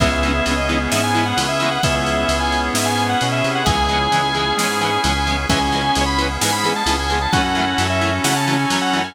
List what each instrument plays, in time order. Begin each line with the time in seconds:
0.00 synth bass 1 C#2, overdriven guitar E3 G#3 B3, drawbar organ B3 C#4 E4 G#4 E5, clarinet B3, kick, crash
0.06 overdriven guitar C#4
0.12 drawbar organ E5
0.23 overdriven guitar E3 G#3 B3, ride
0.29 overdriven guitar C#4
0.45 synth bass 1 C#2, overdriven guitar E3 G#3 B3, ride
0.51 overdriven guitar C#4
0.57 drawbar organ D#5
0.68 overdriven guitar E3 G#3, clarinet B3, ride
0.73 overdriven guitar B3 C#4
0.90 synth bass 1 G#2, overdriven guitar E3 G#3, drawbar organ B3 C#4 G#4 B4 E5, snare
0.95 overdriven guitar B3 C#4
1.03 drawbar organ G#5
1.15 overdriven guitar E3 G#3 B3, ride
1.20 overdriven guitar C#4
1.25 drawbar organ F#5
1.37 synth bass 1 C#2, overdriven guitar E3 G#3, ride
1.41 overdriven guitar B3 C#4
1.48 drawbar organ E5
1.60 overdriven guitar E3 G#3, ride
1.64 overdriven guitar B3 C#4
1.71 drawbar organ F#5
1.83 synth bass 1 C#2, drawbar organ B3 C#4 E4 G#4 E5, clarinet B3, kick, ride
1.96 drawbar organ E5
2.06 ride
2.29 synth bass 1 C#2, ride
2.40 drawbar organ G#5
2.52 ride
2.74 synth bass 1 G#2, drawbar organ B3 C#4 G#4 B4 E5, snare
2.86 drawbar organ G#5
2.97 ride
3.09 drawbar organ F#5
3.21 synth bass 1 B2, clarinet C#4, ride
3.32 drawbar organ E5
3.44 synth bass 1 C3, ride
3.55 drawbar organ F#5
3.65 synth bass 1 C#2, overdriven guitar E3 G#3, drawbar organ B3 C#4 E4 G#4 G#5, clarinet G#4, kick, ride
3.70 overdriven guitar B3 C#4
3.89 overdriven guitar E3 G#3, ride
3.93 overdriven guitar B3 C#4
4.11 synth bass 1 C#2, overdriven guitar E3 G#3, ride
4.16 overdriven guitar B3 C#4
4.34 overdriven guitar E3 G#3, clarinet G#4, ride
4.39 overdriven guitar B3 C#4
4.57 synth bass 1 G#2, overdriven guitar E3 G#3, drawbar organ B3 C#4 G#4 B4 G#5, snare
4.62 overdriven guitar B3 C#4
4.81 overdriven guitar E3 G#3 B3, drawbar organ G#5, ride
4.86 overdriven guitar C#4
5.04 synth bass 1 C#2, overdriven guitar E3 G#3 B3, ride
5.09 overdriven guitar C#4
5.27 overdriven guitar E3 G#3 B3, ride
5.32 overdriven guitar C#4
5.49 synth bass 1 C#2, overdriven guitar E3 G#3, drawbar organ B3 C#4 E4 G#4 G#5, clarinet C#4, kick, ride
5.53 overdriven guitar B3 C#4
5.61 drawbar organ G#5
5.72 overdriven guitar E3 G#3, ride
5.76 overdriven guitar B3 C#4
5.95 synth bass 1 C#2, overdriven guitar E3 G#3 B3, ride
6.01 overdriven guitar C#4
6.06 drawbar organ B5
6.18 overdriven guitar E3 G#3 B3, ride
6.24 overdriven guitar C#4
6.41 synth bass 1 G#2, overdriven guitar E3 G#3 B3, drawbar organ G#5, snare
6.47 overdriven guitar C#4
6.52 drawbar organ B5
6.64 overdriven guitar E3 G#3 B3, ride
6.69 overdriven guitar C#4
6.76 drawbar organ A5
6.86 synth bass 1 C#2, overdriven guitar E3 G#3, ride
6.90 overdriven guitar B3 C#4
6.99 drawbar organ G#5
7.10 overdriven guitar E3 G#3, ride
7.14 overdriven guitar B3 C#4
7.22 drawbar organ A5
7.32 synth bass 1 F#2, overdriven guitar E3 F#3, drawbar organ C#4 E4 F#4 A4 F#5, clarinet C#4, kick, ride
7.36 overdriven guitar A3 C#4
7.44 drawbar organ F#5
7.55 overdriven guitar E3 F#3, ride
7.59 overdriven guitar A3 C#4
7.78 synth bass 1 F#2, overdriven guitar E3 F#3, ride
7.82 overdriven guitar A3 C#4
7.90 drawbar organ E5
8.01 overdriven guitar E3 F#3 A3, ride
8.07 overdriven guitar C#4
8.24 synth bass 1 C#3, overdriven guitar E3 F#3, drawbar organ C#4 E4 A4 C#5 F#5, snare
8.28 overdriven guitar A3 C#4
8.36 drawbar organ A5
8.47 overdriven guitar E3 F#3 A3, ride
8.53 overdriven guitar C#4
8.59 drawbar organ G#5
8.70 synth bass 1 F#2, overdriven guitar E3 F#3 A3, ride
8.76 overdriven guitar C#4
8.81 drawbar organ F#5
8.93 overdriven guitar E3 F#3 A3, ride
8.99 overdriven guitar C#4
9.04 drawbar organ G#5